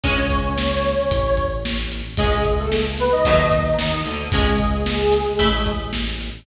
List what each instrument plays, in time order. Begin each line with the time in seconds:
0.04 synth bass 1 C#2, acoustic guitar (steel) G#3 C#4, lead 1 (square) C#4 C#5, kick, closed hi-hat
0.30 kick, closed hi-hat
0.58 snare
0.84 snare, closed hi-hat
1.10 synth bass 1 A1, kick, closed hi-hat
1.37 kick, closed hi-hat
1.65 snare
1.92 closed hi-hat
2.17 synth bass 1 C#2, lead 1 (square) G#3 G#4, acoustic guitar (steel) G#3 C#4, kick, closed hi-hat
2.45 kick, closed hi-hat
2.59 lead 1 (square) A3 A4
2.72 snare
2.98 lead 1 (square) B3 B4, snare, closed hi-hat
3.12 lead 1 (square) D#4 D#5
3.25 synth bass 1 D#2, acoustic guitar (steel) F#3 A3 D#4, kick, closed hi-hat
3.52 kick, closed hi-hat
3.79 synth bass 1 D#2, acoustic guitar (steel) D#3, snare
4.05 synth bass 1 D2, acoustic guitar (steel) D3, closed hi-hat
4.32 synth bass 1 C#2, acoustic guitar (steel) G#3 C#4, lead 1 (square) G#3 G#4, kick, closed hi-hat
4.59 kick, closed hi-hat
4.86 snare
5.12 snare, closed hi-hat
5.39 synth bass 1 A1, acoustic guitar (steel) A3 E4, kick, closed hi-hat
5.66 kick, closed hi-hat
5.93 snare
6.21 closed hi-hat